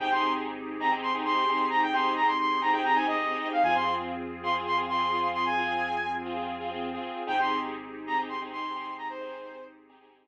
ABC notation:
X:1
M:4/4
L:1/16
Q:1/4=132
K:Ab
V:1 name="Lead 2 (sawtooth)"
g c'2 z4 b z c' z c'4 b | g c'2 b c' c'2 b g b a e4 f | a c'2 z4 c' z c' z c'4 c' | a6 z10 |
g c'2 z4 b z c' z c'4 b | c6 z10 |]
V:2 name="Lead 2 (sawtooth)"
[CEGA] [CEGA]6 [CEGA] [CEGA]2 [CEGA] [CEGA]2 [CEGA]3- | [CEGA] [CEGA]6 [CEGA] [CEGA]2 [CEGA] [CEGA]2 [CEGA]3 | [CFA] [CFA]6 [CFA] [CFA]2 [CFA] [CFA]2 [CFA]3- | [CFA] [CFA]6 [CFA] [CFA]2 [CFA] [CFA]2 [CFA]3 |
[CEGA] [CEGA]6 [CEGA] [CEGA]2 [CEGA] [CEGA]2 [CEGA]3- | [CEGA] [CEGA]6 [CEGA] [CEGA]2 [CEGA] z5 |]
V:3 name="Synth Bass 2" clef=bass
A,,,16- | A,,,16 | F,,16- | F,,16 |
A,,,16- | A,,,16 |]
V:4 name="Pad 5 (bowed)"
[CEGA]16- | [CEGA]16 | [CFA]16- | [CFA]16 |
[CEGA]16- | [CEGA]16 |]